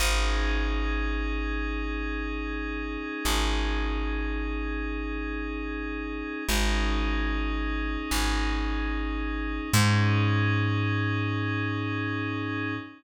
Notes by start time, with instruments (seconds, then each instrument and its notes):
0.00 electric bass (finger) G#1, pad 5 (bowed) C#4 D#4 G#4
3.25 electric bass (finger) G#1
6.48 electric bass (finger) G#1, pad 5 (bowed) C#4 D#4 G#4
8.11 electric bass (finger) G#1
9.73 electric bass (finger) G#2, pad 5 (bowed) C#4 D#4 G#4